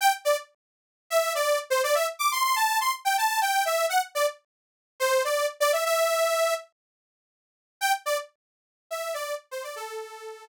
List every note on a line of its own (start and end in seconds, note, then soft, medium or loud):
0.01 0.12 G5 loud
0.25 0.36 D5 loud
1.10 1.33 E5 loud
1.35 1.59 D5 loud
1.70 1.82 C5 loud
1.84 1.95 D5 loud
1.95 2.06 E5 loud
2.19 2.30 D6 loud
2.32 2.43 C6 loud
2.44 2.56 C6 loud
2.56 2.79 A5 loud
2.80 2.92 C6 loud
3.05 3.16 G5 loud
3.18 3.40 A5 loud
3.41 3.64 G5 loud
3.65 3.86 E5 loud
3.89 4.01 F#5 loud
4.15 4.26 D5 loud
5.00 5.23 C5 loud
5.24 5.46 D5 medium
5.60 5.72 D5 loud
5.73 5.84 E5 loud
5.85 6.54 E5 loud
7.81 7.92 G5 loud
8.06 8.17 D5 loud
8.91 9.14 E5 medium
9.14 9.35 D5 loud
9.51 9.63 C5 loud
9.63 9.75 D5 loud
9.76 10.45 A4 loud